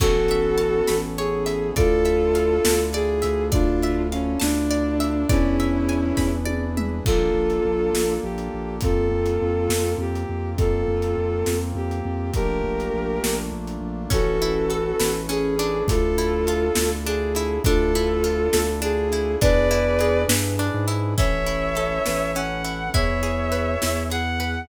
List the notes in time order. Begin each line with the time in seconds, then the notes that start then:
0.00 A1 B3 C#4 E4 F#4 A4 C#5, kick, crash
0.28 E5, closed hi-hat
0.58 A5, closed hi-hat
0.87 A1 B5, snare
1.18 G#4 C#5, closed hi-hat
1.46 E5, closed hi-hat
1.76 D2 D4 E4 F4 A4 D5, kick, closed hi-hat
2.05 E5, closed hi-hat
2.35 F5, closed hi-hat
2.65 D2 A5, snare
2.93 G#4 D5, closed hi-hat
3.22 D2 E5, closed hi-hat
3.52 D4 E4 F4 A4 D5, kick, closed hi-hat
3.82 E5, closed hi-hat
4.12 C#4 F5, closed hi-hat
4.40 D2 D4 A5, snare
4.71 D5, closed hi-hat
5.00 E5, closed hi-hat
5.29 E2 C#4 D4 E4 G#4 B4 D5, kick, closed hi-hat
5.60 E5, closed hi-hat
5.89 G#5, closed hi-hat
6.17 E2 B5, kick, snare
6.45 D5, high tom
6.77 E5, mid tom
7.05 A#1 A#3 D4 F4 A4, kick, crash
7.34 A#1
7.50 closed hi-hat
7.65 A#1
7.93 A#1, snare
8.23 A#1 G4
8.38 closed hi-hat
8.54 A#1
8.81 F2 A#3 C4 F4 A4, kick, closed hi-hat
9.12 F2
9.26 closed hi-hat
9.42 F2
9.69 F2, snare
9.98 F2 G4
10.15 closed hi-hat
10.29 F2
10.57 F2 A#3 C4 F4 A4, kick, closed hi-hat
10.88 F2
11.02 closed hi-hat
11.18 F2
11.46 F2, snare
11.75 F2 G4
11.91 closed hi-hat
12.05 F2
12.34 A#1 A3 A#3 D4 F4 G4 A#4, kick, closed hi-hat
12.64 A#1
12.80 closed hi-hat
12.94 A#1
13.24 A#1, snare
13.52 A#1
13.67 closed hi-hat
13.81 A#1
14.10 A1 C#4 E4 F#4 A4 B4, kick, closed hi-hat
14.42 E4, closed hi-hat
14.70 A4, closed hi-hat
15.00 A1 B4, snare
15.29 C#4 G#4, closed hi-hat
15.59 D4, closed hi-hat
15.87 D2 D4 E4 F4 A4, kick, closed hi-hat
16.18 E4, closed hi-hat
16.47 F4, closed hi-hat
16.75 D2 A4, snare
17.05 D4 G#4, closed hi-hat
17.35 E4, closed hi-hat
17.64 D2 D4 E4 F4 A4, kick, closed hi-hat
17.95 E4, closed hi-hat
18.24 F4, closed hi-hat
18.53 D2 A4, snare
18.82 D4 G#4, closed hi-hat
19.12 E4, closed hi-hat
19.41 E2 D4 E4 G#4 B4 D5, kick, closed hi-hat
19.71 E4, closed hi-hat
19.99 G#4, closed hi-hat
20.28 G2 B4, snare
20.59 D4, closed hi-hat
20.74 G#2
20.88 E4, closed hi-hat
21.17 A1 C#4 E4 A4 B4 C#5 E5, kick, closed hi-hat
21.46 E4, closed hi-hat
21.75 A4, closed hi-hat
22.06 A1 B4, snare
22.35 C#4 F#5, closed hi-hat
22.64 E4, closed hi-hat
22.94 E2 E4 G#4 B4 C#5 E5, kick, closed hi-hat
23.23 G#4, closed hi-hat
23.52 B4, closed hi-hat
23.82 E2 E4, snare
24.10 G#4 F#5, closed hi-hat
24.40 B4, closed hi-hat